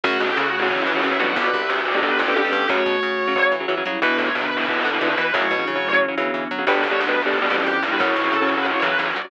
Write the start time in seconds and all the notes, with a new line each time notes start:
0.04 F#2 C#3 F#3 A3 F#4 C#5 F#5, kick, crash
0.20 B2 G4, kick
0.27 C#4 A4
0.37 C#3 F#4
0.48 A3 F#4
0.59 C#3 F#3 E4
0.70 C#3 E3 F#3 C#4 F#4, kick
0.81 C#4
0.87 E3 C#4
0.93 C#3 F#3 D4
1.04 C#3 E3 F#3 E4
1.11 C#3 F#3
1.20 B2 D3 F#3 G3 F#4
1.36 G1 F#4 B4 D5 G5, kick
1.54 C2, kick
1.60 G4 E5
1.69 D2 A4
1.81 F#4 B4 D5
1.92 B2 D3 G3 C#5
2.02 B2 D3 G3 B3 G4 B4, kick
2.19 F2 C#4 G4 A4
2.28 B2 D3 G3
2.36 F2 B2 D3 G3 G4
2.44 B2 D3 G3
2.52 G2 B2 D3 G3
2.69 F#2 C#3 F#3 A3 F#4 C#5 F#5, kick
2.86 B2, kick
3.03 C#3
3.27 C#3 F#3
3.35 C#3 F#3 A3 F#4, kick
3.52 E3
3.60 C#3 F#3
3.68 C#3 E3 F#3
3.77 C#3 F#3
3.85 C#3 F#3 G3 E4
4.01 E2 B2 D3 E3 B3 B4 E5, kick
4.18 A2 C#5, kick
4.35 B2 D3 B3 B4
4.46 B4
4.57 B2 E3 A4
4.68 B2 E3 B4, kick
4.79 F#4
4.85 D3
4.90 B2 E3 G4
5.01 B2 D3 E3 B4
5.09 B2 E3
5.18 B2 E3 B4
5.34 F#2 A2 C#3 F#3 C#4 F#4 C#5, kick
5.51 B2
5.56 G2 C#3 E3 F#3
5.67 C#3
5.75 A2 C#3 F#3
5.93 C#3 F#3
6.00 E3 C#4, kick
6.08 C#3 F#3
6.16 C#3 D3 E3 F#3 B3
6.34 E3
6.51 F#3
6.59 C#3 F#3
6.67 G1 B2 D3 G3 B3 D4 G4 B4, kick
6.83 C2 C#5, kick
6.91 B2 D3 G3
7.00 D2 B4
7.08 B2 D3 G3 B4
7.22 B2 D3 G3 A4
7.33 D3 B3 B4, kick
7.42 B2 D3 G3 F#4
7.50 F2 B2 D3 E3 G3 C#4
7.56 G4
7.66 F2 G4
7.83 G2 G3 E4 B4
7.92 B2 D3 G3
7.99 F#2 C#3 F#3 C#4 E4 F#4 C#5, kick
8.11 G4
8.16 B2, kick
8.22 C#3 F#3 A4
8.33 C#3 A4
8.42 C#3 F#3
8.49 B4
8.57 C#3 F#3
8.66 E4 C#5, kick
8.75 C#3 F#3
8.82 C#3 E3 F#3 B4
8.99 E3 C#5
9.10 D5
9.16 F#3 F#4 D5
9.21 C#3 F#3 D5